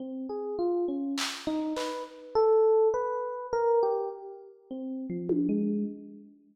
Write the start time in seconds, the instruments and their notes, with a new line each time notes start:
0.00 electric piano 1 C4
0.29 electric piano 1 G#4
0.59 electric piano 1 F4
0.88 electric piano 1 C#4
1.18 clap
1.47 electric piano 1 D#4
1.76 electric piano 1 B4, clap
2.35 electric piano 1 A4
2.94 electric piano 1 B4
3.53 electric piano 1 A#4
3.83 electric piano 1 G4
4.71 electric piano 1 C4
5.10 electric piano 1 F3
5.29 high tom
5.49 electric piano 1 G#3